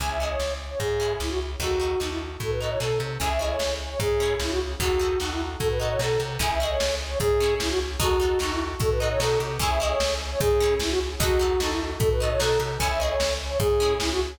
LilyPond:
<<
  \new Staff \with { instrumentName = "Flute" } { \time 2/4 \key cis \minor \tempo 4 = 150 gis''16 e''16 dis''16 cis''8. r16 cis''16 | gis'4 e'16 fis'16 r8 | fis'4 dis'16 e'16 r8 | a'16 b'16 dis''16 cis''16 a'8 r8 |
gis''16 e''16 dis''16 cis''8. r16 cis''16 | gis'4 e'16 fis'16 r8 | fis'4 dis'16 e'16 r8 | a'16 b'16 dis''16 cis''16 a'8 r8 |
gis''16 e''16 dis''16 cis''8. r16 cis''16 | gis'4 e'16 fis'16 r8 | fis'4 dis'16 e'16 r8 | a'16 b'16 dis''16 cis''16 a'8 r8 |
gis''16 e''16 dis''16 cis''8. r16 cis''16 | gis'4 e'16 fis'16 r8 | fis'4 dis'16 e'16 r8 | a'16 b'16 dis''16 cis''16 a'8 r8 |
gis''16 e''16 dis''16 cis''8. r16 cis''16 | gis'4 e'16 fis'16 r8 | }
  \new Staff \with { instrumentName = "Orchestral Harp" } { \time 2/4 \key cis \minor <cis' e' gis'>8 <cis' e' gis'>4.~ | <cis' e' gis'>8 <cis' e' gis'>4. | <dis' fis' a'>8 <dis' fis' a'>8 <dis' fis' a'>4~ | <dis' fis' a'>8 <dis' fis' a'>8 <dis' fis' a'>4 |
<cis' e' gis'>8 <cis' e' gis'>4.~ | <cis' e' gis'>8 <cis' e' gis'>4. | <dis' fis' a'>8 <dis' fis' a'>8 <dis' fis' a'>4~ | <dis' fis' a'>8 <dis' fis' a'>8 <dis' fis' a'>4 |
<cis' e' gis'>8 <cis' e' gis'>4.~ | <cis' e' gis'>8 <cis' e' gis'>4. | <dis' fis' a'>8 <dis' fis' a'>8 <dis' fis' a'>4~ | <dis' fis' a'>8 <dis' fis' a'>8 <dis' fis' a'>4 |
<cis' e' gis'>8 <cis' e' gis'>4.~ | <cis' e' gis'>8 <cis' e' gis'>4. | <dis' fis' a'>8 <dis' fis' a'>8 <dis' fis' a'>4~ | <dis' fis' a'>8 <dis' fis' a'>8 <dis' fis' a'>4 |
<cis' e' gis'>8 <cis' e' gis'>4.~ | <cis' e' gis'>8 <cis' e' gis'>4. | }
  \new Staff \with { instrumentName = "Electric Bass (finger)" } { \clef bass \time 2/4 \key cis \minor cis,4 cis,4 | gis,4 cis,4 | dis,4 dis,4 | a,4 b,8 bis,8 |
cis,4 cis,4 | gis,4 cis,4 | dis,4 dis,4 | a,4 b,8 bis,8 |
cis,4 cis,4 | gis,4 cis,4 | dis,4 dis,4 | a,4 b,8 bis,8 |
cis,4 cis,4 | gis,4 cis,4 | dis,4 dis,4 | a,4 b,8 bis,8 |
cis,4 cis,4 | gis,4 cis,4 | }
  \new DrumStaff \with { instrumentName = "Drums" } \drummode { \time 2/4 <hh bd>4 sn4 | <hh bd>4 sn4 | <hh bd>4 sn4 | <hh bd>4 sn4 |
<hh bd>4 sn4 | <hh bd>4 sn4 | <hh bd>4 sn4 | <hh bd>4 sn4 |
<hh bd>4 sn4 | <hh bd>4 sn4 | <hh bd>4 sn4 | <hh bd>4 sn4 |
<hh bd>4 sn4 | <hh bd>4 sn4 | <hh bd>4 sn4 | <hh bd>4 sn4 |
<hh bd>4 sn4 | <hh bd>4 sn4 | }
>>